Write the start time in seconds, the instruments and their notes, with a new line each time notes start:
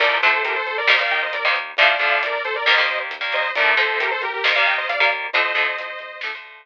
0.00 synth bass 1 D2, overdriven guitar D3 F3 A3, lead 2 (sawtooth) A#4 D5, kick, crash
0.22 synth bass 1 D2, overdriven guitar D3 F3 A3, lead 2 (sawtooth) A4 C5, closed hi-hat
0.44 synth bass 1 D2, lead 2 (sawtooth) G4 A#4, closed hi-hat
0.56 lead 2 (sawtooth) A4 C5
0.67 synth bass 1 D2, lead 2 (sawtooth) A4 C5, closed hi-hat
0.78 lead 2 (sawtooth) A#4 D5
0.87 synth bass 1 D#2, overdriven guitar D#3 G3 A#3, lead 2 (sawtooth) C5 D#5, snare
0.99 overdriven guitar D#3 G3 A#3, lead 2 (sawtooth) D5 F5
1.11 synth bass 1 D#2, lead 2 (sawtooth) D#5 G5, closed hi-hat
1.22 lead 2 (sawtooth) C5 D#5
1.33 synth bass 1 D#2, lead 2 (sawtooth) A#4 D5, closed hi-hat
1.44 overdriven guitar D#3 G3 A#3, lead 2 (sawtooth) C5 D#5
1.55 synth bass 1 D#2, closed hi-hat
1.77 synth bass 1 D2, overdriven guitar D3 F3 A3, lead 2 (sawtooth) D5 F5, kick, closed hi-hat
1.89 lead 2 (sawtooth) D5 F5
1.99 synth bass 1 D2, overdriven guitar D3 F3 A3, lead 2 (sawtooth) D5 F5, kick, closed hi-hat
2.22 synth bass 1 D2, lead 2 (sawtooth) A#4 D5, closed hi-hat
2.44 synth bass 1 D2, lead 2 (sawtooth) A4 C5, closed hi-hat
2.56 lead 2 (sawtooth) A#4 D5
2.66 synth bass 1 D#2, overdriven guitar D#3 G3 A#3, lead 2 (sawtooth) C5 D#5, snare
2.78 overdriven guitar D#3 G3 A#3
2.88 synth bass 1 D#2, closed hi-hat
3.11 synth bass 1 D#2, closed hi-hat
3.21 overdriven guitar D#3 G3 A#3
3.32 synth bass 1 D#2, lead 2 (sawtooth) C5 D#5, closed hi-hat
3.55 synth bass 1 D2, overdriven guitar D3 F3 A3, lead 2 (sawtooth) A#4 D5, kick, closed hi-hat
3.77 synth bass 1 D2, overdriven guitar D3 F3 A3, lead 2 (sawtooth) A4 C5, kick, closed hi-hat
4.00 synth bass 1 D2, lead 2 (sawtooth) G4 A#4, closed hi-hat
4.11 lead 2 (sawtooth) A4 C5
4.22 synth bass 1 D2, lead 2 (sawtooth) G4 A#4, closed hi-hat
4.33 lead 2 (sawtooth) G4 A#4
4.44 synth bass 1 D#2, overdriven guitar D#3 G3 A#3, lead 2 (sawtooth) C5 D#5, snare
4.55 overdriven guitar D#3 G3 A#3, lead 2 (sawtooth) D5 F5
4.66 synth bass 1 D#2, lead 2 (sawtooth) D#5 G5, closed hi-hat
4.78 lead 2 (sawtooth) C5 D#5
4.89 synth bass 1 D#2, lead 2 (sawtooth) D5 F5, closed hi-hat
5.00 overdriven guitar D#3 G3 A#3, lead 2 (sawtooth) D5 F5
5.11 synth bass 1 D#2, closed hi-hat
5.33 synth bass 1 D2, overdriven guitar D3 F3 A3, lead 2 (sawtooth) C5 D#5, kick, closed hi-hat
5.55 synth bass 1 D2, overdriven guitar D3 F3 A3, kick, closed hi-hat
5.77 synth bass 1 D2, closed hi-hat
5.99 synth bass 1 D2, closed hi-hat
6.21 synth bass 1 D2, overdriven guitar D3 F3 A3, snare
6.35 overdriven guitar D3 F3 A3
6.44 synth bass 1 D2, closed hi-hat